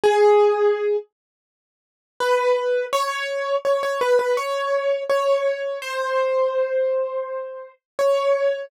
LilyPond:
\new Staff { \time 4/4 \key fis \minor \tempo 4 = 83 gis'4. r4. b'4 | cis''4 cis''16 cis''16 b'16 b'16 cis''4 cis''4 | bis'2. cis''4 | }